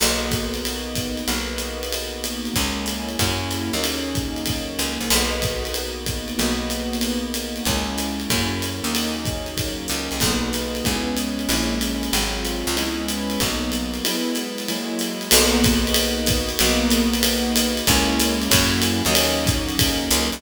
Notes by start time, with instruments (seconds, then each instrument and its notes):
0.00 electric bass (finger) B1, acoustic grand piano A#3 B3 D#4 F#4, crash, ride
0.31 kick, hi-hat pedal, ride
0.54 ride
0.65 ride
0.95 kick, hi-hat pedal, ride
1.17 ride
1.28 electric bass (finger) B1, acoustic grand piano A#3 B3 D#4 F#4, ride
1.58 hi-hat pedal, ride
1.83 ride
1.92 ride
2.24 hi-hat pedal, ride
2.45 ride
2.54 electric bass (finger) C#2, acoustic grand piano G#3 A#3 C#4 E4, kick, ride
2.86 hi-hat pedal, ride
3.09 ride
3.19 electric bass (finger) F#2, acoustic grand piano F#3 A#3 C#4 E4, kick, ride
3.51 hi-hat pedal, ride
3.73 electric bass (finger) D#2, acoustic grand piano F#3 A#3 C#4 D#4, ride
3.84 ride
4.15 kick, hi-hat pedal, ride
4.36 ride
4.46 kick, ride
4.79 electric bass (finger) C#2, hi-hat pedal, ride
5.00 electric bass (finger) C2, ride
5.10 electric bass (finger) B1, acoustic grand piano A#3 B3 D#4 F#4, crash, ride
5.42 kick, hi-hat pedal, ride
5.65 ride
5.74 ride
6.06 kick, hi-hat pedal, ride
6.28 ride
6.38 electric bass (finger) B1, acoustic grand piano A#3 B3 D#4 F#4, ride
6.70 hi-hat pedal, ride
6.93 ride
7.01 ride
7.34 hi-hat pedal, ride
7.56 ride
7.65 electric bass (finger) C#2, acoustic grand piano G#3 A#3 C#4 E4, kick, ride
7.98 hi-hat pedal, ride
8.20 ride
8.30 electric bass (finger) F#2, acoustic grand piano F#3 A#3 C#4 E4, kick, ride
8.62 hi-hat pedal, ride
8.84 electric bass (finger) D#2, acoustic grand piano F#3 A#3 C#4 D#4, ride
8.95 ride
9.25 kick, hi-hat pedal, ride
9.46 ride
9.57 kick, ride
9.88 electric bass (finger) C#2, hi-hat pedal, ride
10.11 electric bass (finger) C2, ride
10.20 electric bass (finger) B1, acoustic grand piano A#3 B3 D#4 F#4, kick, crash, ride
10.53 hi-hat pedal, ride
10.75 ride
10.84 electric bass (finger) C#2, acoustic grand piano G#3 B3 C#4 E4, kick, ride
11.17 hi-hat pedal, ride
11.39 ride
11.49 electric bass (finger) A#1, acoustic grand piano G#3 A#3 C#4 E4, ride
11.81 hi-hat pedal, ride
12.03 ride
12.12 electric bass (finger) G#1, acoustic grand piano F#3 G#3 C4 F4, ride
12.45 hi-hat pedal, ride
12.67 electric bass (finger) C#2, ride
12.76 acoustic grand piano G#3 B3 C#4 E4, ride
13.08 hi-hat pedal, ride
13.30 ride
13.40 electric bass (finger) B1, acoustic grand piano F#3 A#3 B3 D#4, kick, ride
13.72 hi-hat pedal, ride
13.94 ride
14.05 acoustic grand piano F#3 G#3 B3 E4, ride
14.35 hi-hat pedal, ride
14.58 ride
14.68 acoustic grand piano F#3 G#3 A#3 E4, ride
14.99 hi-hat pedal, ride
15.21 ride
15.31 electric bass (finger) B1, acoustic grand piano A#3 B3 D#4 F#4, crash, ride
15.64 kick, hi-hat pedal, ride
15.87 ride
15.94 ride
16.26 kick, hi-hat pedal, ride
16.49 ride
16.59 electric bass (finger) B1, acoustic grand piano A#3 B3 D#4 F#4, ride
16.90 hi-hat pedal, ride
17.13 ride
17.23 ride
17.56 hi-hat pedal, ride
17.77 ride
17.87 electric bass (finger) C#2, acoustic grand piano G#3 A#3 C#4 E4, kick, ride
18.19 hi-hat pedal, ride
18.42 ride
18.50 electric bass (finger) F#2, acoustic grand piano F#3 A#3 C#4 E4, kick, ride
18.82 hi-hat pedal, ride
19.05 electric bass (finger) D#2, acoustic grand piano F#3 A#3 C#4 D#4, ride
19.15 ride
19.46 kick, hi-hat pedal, ride
19.69 ride
19.79 kick, ride
20.11 electric bass (finger) C#2, hi-hat pedal, ride
20.32 electric bass (finger) C2, ride